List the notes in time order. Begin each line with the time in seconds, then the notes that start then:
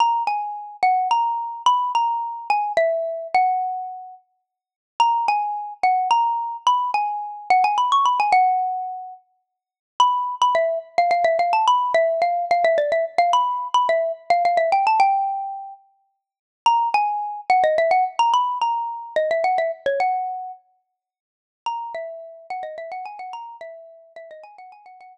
0.00 A#5
0.27 G#5
0.83 F#5
1.11 A#5
1.66 B5
1.95 A#5
2.50 G#5
2.77 E5
3.34 F#5
5.00 A#5
5.28 G#5
5.83 F#5
6.11 A#5
6.67 B5
6.94 G#5
7.50 F#5
7.64 G#5
7.78 B5
7.92 C#6
8.05 B5
8.20 G#5
8.32 F#5
10.00 B5
10.42 B5
10.55 E5
10.98 F5
11.11 F5
11.24 E5
11.39 F5
11.53 A5
11.67 B5
11.94 E5
12.22 F5
12.51 F5
12.64 E5
12.78 D5
12.92 E5
13.18 F5
13.33 B5
13.74 B5
13.89 E5
14.30 F5
14.45 F5
14.57 E5
14.72 G5
14.87 A5
15.00 G5
16.66 A#5
16.94 G#5
17.50 F#5
17.64 D#5
17.78 E5
17.91 F#5
18.19 A#5
18.34 B5
18.61 A#5
19.16 D#5
19.31 E5
19.44 F#5
19.58 E5
19.86 C#5
20.00 F#5
21.66 A#5
21.95 E5
22.50 F#5
22.63 D#5
22.78 E5
22.92 F#5
23.05 G#5
23.19 F#5
23.33 A#5
23.61 E5
24.16 E5
24.31 D#5
24.43 G#5
24.58 F#5
24.72 G#5
24.86 F#5
25.01 F#5